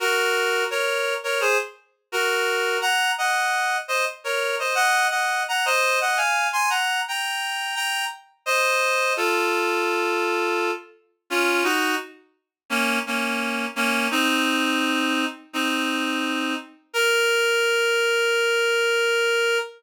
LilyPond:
\new Staff { \time 4/4 \key bes \minor \tempo 4 = 85 <ges' bes'>4 <bes' des''>8. <bes' des''>16 <aes' c''>16 r8. <ges' bes'>4 | <ges'' bes''>8 <ees'' ges''>4 <c'' ees''>16 r16 <bes' des''>8 <c'' ees''>16 <ees'' ges''>8 <ees'' ges''>8 <ges'' bes''>16 | <c'' ees''>8 <ees'' ges''>16 <f'' aes''>8 <aes'' c'''>16 <ges'' bes''>8 <g'' bes''>4 <g'' bes''>8 r8 | <c'' ees''>4 <f' a'>2~ <f' a'>8 r8 |
<des' f'>8 <ees' ges'>8 r4 <bes des'>8 <bes des'>4 <bes des'>8 | <c' ees'>2 <c' ees'>4. r8 | bes'1 | }